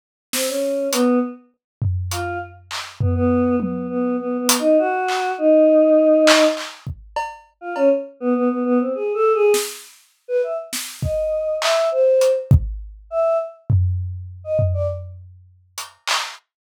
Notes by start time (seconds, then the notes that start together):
0.33 C4, snare
0.48 C#4
0.92 B3, closed hi-hat
1.82 floor tom
2.11 F4, closed hi-hat
2.71 clap
3.00 B3, floor tom
3.15 B3
3.60 B3, high tom
3.90 B3
4.19 B3
4.39 B3
4.49 closed hi-hat
4.59 D#4
4.79 F#4
5.08 clap
5.38 D#4
6.27 clap
6.57 clap
6.87 kick
7.16 cowbell
7.61 F4
7.76 C#4, cowbell
8.20 B3
8.35 B3
8.50 B3
8.65 B3
8.80 C4
8.95 G#4
9.14 A4
9.34 G#4
9.54 snare
10.28 B4
10.43 E5
10.73 snare
11.02 D#5, kick
11.62 E5, clap
11.91 C5
12.21 closed hi-hat
12.51 kick
13.10 E5
13.70 floor tom
14.44 D#5
14.59 floor tom
14.74 D5
15.78 closed hi-hat
16.07 clap